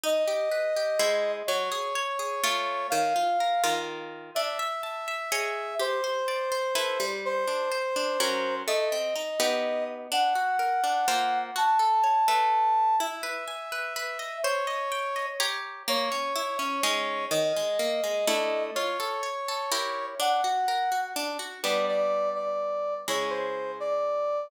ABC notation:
X:1
M:3/4
L:1/8
Q:1/4=125
K:Bdor
V:1 name="Brass Section"
^d6 | c6 | ^e4 z2 | e6 |
=c6 | =c6 | _e5 z | f6 |
a6 | e6 | c4 z2 | c6 |
^d6 | c6 | f4 z2 | [K:Ddor] d d2 d3 |
^c =c2 d3 |]
V:2 name="Orchestral Harp"
^D =G B G [^G,E^B]2 | F, G c G [A,^Ec]2 | ^D, ^E ^A [D,EA]3 | D e a e [Gc^d]2 |
=G =c d c [EAB] =G,- | =G, D =c D [F,^C^A]2 | A, =C _E [B,^D=G]3 | D F ^A D [^A,^E^B]2 |
F A c [A,Be]3 | E B g B B ^d | =c _e =g e [=G_d_b]2 | ^A, C E C [G,C^D]2 |
^D, G, ^A, G, [=A,=DE]2 | =F A c A [E=G_B]2 | D F ^A F D F | [K:Ddor] [G,B,D]6 |
[^C,^G,E]6 |]